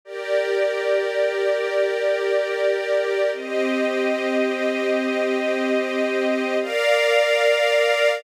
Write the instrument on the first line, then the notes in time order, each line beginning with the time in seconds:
string ensemble 1
0.05 G4 A#4 D5
3.32 C4 G4 D#5
6.61 A#4 D5 F5